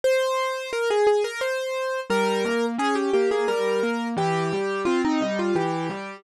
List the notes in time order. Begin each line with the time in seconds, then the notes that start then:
0.04 C5
0.73 A#4
0.90 G#4
1.07 G#4
1.24 A#4
1.41 C5
2.10 G3 A#4
2.45 A#3
2.78 C#4 G#4
2.95 G4
3.13 A#3 G4
3.31 G#4
3.48 G3 A#4
3.83 A#3
4.17 E3 G4
4.52 G3
4.85 C4 F4
5.05 D#4
5.20 G3 D#4
5.39 F4
5.55 E3 G4
5.89 G3